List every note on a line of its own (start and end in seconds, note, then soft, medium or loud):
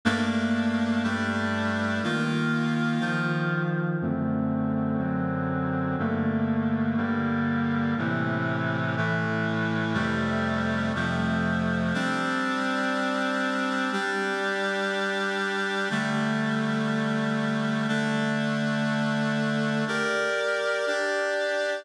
0.05 1.03 G2 medium
0.05 1.03 A3 medium
0.05 1.03 A#3 medium
0.05 1.03 D4 medium
1.03 2.01 G2 medium
1.03 2.01 G3 medium
1.03 2.01 A3 medium
1.03 2.01 D4 medium
2.03 2.99 D#3 medium
2.03 3.01 A#3 medium
2.03 2.99 F4 medium
3.00 3.98 D#3 medium
3.00 3.98 F3 medium
3.00 3.98 F4 medium
4.01 4.97 F#2 medium
4.01 4.97 D3 medium
4.01 5.00 A3 medium
4.01 4.97 C4 medium
4.98 5.96 F#2 medium
4.98 5.96 D3 medium
4.98 5.96 F#3 medium
4.98 5.96 C4 medium
5.98 6.96 G2 medium
5.98 6.96 D3 medium
5.98 6.97 A3 medium
5.98 6.96 A#3 medium
6.97 7.95 G2 medium
6.97 7.95 D3 medium
6.97 7.95 G3 medium
6.97 7.95 A#3 medium
7.97 8.96 A2 medium
7.97 8.96 C3 medium
7.97 8.96 E3 medium
8.97 9.95 A2 medium
8.97 9.95 E3 medium
8.97 9.93 A3 medium
9.94 10.92 F2 medium
9.94 10.92 C3 medium
9.94 10.92 G3 loud
9.94 10.92 A3 medium
10.95 11.93 F2 medium
10.95 11.93 C3 medium
10.95 11.93 F3 medium
10.95 11.93 A3 medium
11.94 13.90 G3 medium
11.94 13.90 C4 medium
11.94 13.90 D4 loud
13.92 15.89 G3 loud
13.92 15.89 D4 medium
13.92 15.89 G4 medium
15.90 17.87 D3 medium
15.90 17.87 G3 medium
15.90 17.87 A3 loud
17.88 19.84 D3 loud
17.88 19.84 A3 loud
17.88 19.84 D4 loud
19.87 20.86 G4 medium
19.87 20.86 A#4 loud
19.87 20.86 D5 medium
20.87 21.85 D4 medium
20.87 21.85 G4 medium
20.87 21.85 D5 medium